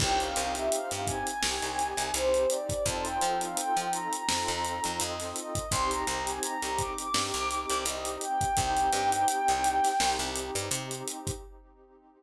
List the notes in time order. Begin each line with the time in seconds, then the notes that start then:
0.00 C2 C4 D#4 G4 G5, kick, crash
0.20 F5, closed hi-hat
0.36 C2, closed hi-hat
0.55 E5, closed hi-hat
0.71 F5, closed hi-hat
0.91 G2 F5, closed hi-hat
1.06 G#5, kick, closed hi-hat
1.27 G#5, closed hi-hat
1.41 C2 C4 D#4 G4, snare
1.62 C2, closed hi-hat
1.79 closed hi-hat
1.97 C2, closed hi-hat
2.14 C2 C5, closed hi-hat
2.34 closed hi-hat
2.50 D5, closed hi-hat
2.69 kick, closed hi-hat
2.85 F2 C4 D#4 F4 A4 A5, kick, closed hi-hat
3.05 G5, closed hi-hat
3.21 F3, closed hi-hat
3.41 F5, closed hi-hat
3.57 G5, closed hi-hat
3.76 F3 G5, closed hi-hat
3.93 A#5, closed hi-hat
4.13 A#5, closed hi-hat
4.28 F2 C4 D#4 F4 A4, snare
4.48 F2, closed hi-hat
4.65 closed hi-hat
4.84 F2, closed hi-hat
5.00 F2 D#5, closed hi-hat
5.20 snare, closed hi-hat
5.36 D#5, closed hi-hat
5.55 kick, closed hi-hat
5.71 C2 C4 D#4 G4 C6, kick, closed hi-hat
5.91 A#5, closed hi-hat
6.07 C2, closed hi-hat
6.27 G#5, closed hi-hat
6.43 A#5, closed hi-hat
6.62 C2 A#5, closed hi-hat
6.79 D6, kick, closed hi-hat
6.98 D6, closed hi-hat
7.13 G2 C4 D#4 G4, snare
7.34 C2, closed hi-hat
7.51 closed hi-hat
7.69 C2, closed hi-hat
7.85 C2 D#5, closed hi-hat
8.05 closed hi-hat
8.21 G5, closed hi-hat
8.41 kick, closed hi-hat
8.57 C2 C4 D#4 G4 G5, kick, closed hi-hat
8.77 closed hi-hat
8.93 G2, snare, closed hi-hat
9.12 closed hi-hat
9.28 closed hi-hat
9.48 C2, closed hi-hat
9.64 closed hi-hat
9.84 snare, closed hi-hat
10.00 C2 C4 D#4 G4, snare
10.19 C2, closed hi-hat
10.36 closed hi-hat
10.55 G2, closed hi-hat
10.71 C3, closed hi-hat
10.91 closed hi-hat
11.08 closed hi-hat
11.27 kick, closed hi-hat